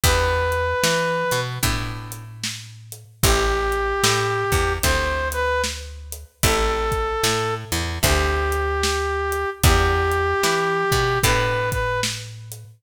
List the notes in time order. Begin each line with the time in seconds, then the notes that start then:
0.04 E2 B3 D4 E4 G4 B4, kick, closed hi-hat
0.52 closed hi-hat
0.84 E3, snare
1.31 B2, closed hi-hat
1.63 A2 B3 D4 E4 G4, kick, closed hi-hat
2.12 closed hi-hat
2.44 snare
2.92 closed hi-hat
3.23 A1 A3 C4 E4 G4, kick, closed hi-hat
3.72 closed hi-hat
4.04 A2, snare
4.52 E2, kick, closed hi-hat
4.83 D2 A3 C4 E4 G4 C5, kick, closed hi-hat
5.32 B4, closed hi-hat
5.64 snare
6.12 closed hi-hat
6.43 A1 A3 C4 E4 G4 A4, kick, closed hi-hat
6.92 kick, closed hi-hat
7.24 A2, snare
7.72 E2, closed hi-hat
8.03 D2 A3 C4 E4 G4, kick, closed hi-hat
8.52 closed hi-hat
8.83 snare
9.32 closed hi-hat
9.63 E2 B3 D4 E4 G4, kick, closed hi-hat
10.12 closed hi-hat
10.43 E3, snare
10.92 B2, kick, closed hi-hat
11.23 A2 B3 D4 E4 G4 B4, kick, closed hi-hat
11.72 B4, kick, closed hi-hat
12.03 snare
12.52 closed hi-hat